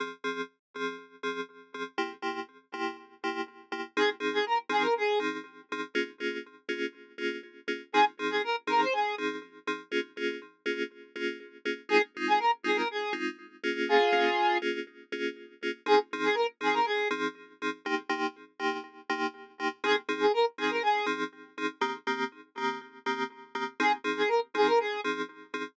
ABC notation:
X:1
M:4/4
L:1/16
Q:1/4=121
K:Fm
V:1 name="Lead 1 (square)"
z16 | z16 | A z2 A B z A B A2 z6 | z16 |
A z2 A B z B c A2 z6 | z16 | A z2 A B z A B A2 z6 | [FA]6 z10 |
A z2 A B z A B A2 z6 | z16 | A z2 A B z A B A2 z6 | z16 |
A z2 A B z A B A2 z6 |]
V:2 name="Electric Piano 2"
[F,CA]2 [F,CA]4 [F,CA]4 [F,CA]4 [F,CA]2 | [C,B,=EG]2 [C,B,EG]4 [C,B,EG]4 [C,B,EG]4 [C,B,EG]2 | [F,CEA]2 [F,CEA]4 [F,CEA]4 [F,CEA]4 [F,CEA]2 | [B,DFA]2 [B,DFA]4 [B,DFA]4 [B,DFA]4 [B,DFA]2 |
[F,CEA]2 [F,CEA]4 [F,CEA]4 [F,CEA]4 [F,CEA]2 | [B,DFA]2 [B,DFA]4 [B,DFA]4 [B,DFA]4 [B,DFA]2 | [A,CEF]2 [A,CEF]4 [A,CEF]4 [A,CEF]4 [B,DFA]2- | [B,DFA]2 [B,DFA]4 [B,DFA]4 [B,DFA]4 [B,DFA]2 |
[F,CEA]2 [F,CEA]4 [F,CEA]4 [F,CEA]4 [F,CEA]2 | [C,B,EG]2 [C,B,EG]4 [C,B,EG]4 [C,B,EG]4 [C,B,EG]2 | [F,CEA]2 [F,CEA]4 [F,CEA]4 [F,CEA]4 [F,CEA]2 | [E,B,CG]2 [E,B,CG]4 [E,B,CG]4 [E,B,CG]4 [E,B,CG]2 |
[F,CEA]2 [F,CEA]4 [F,CEA]4 [F,CEA]4 [F,CEA]2 |]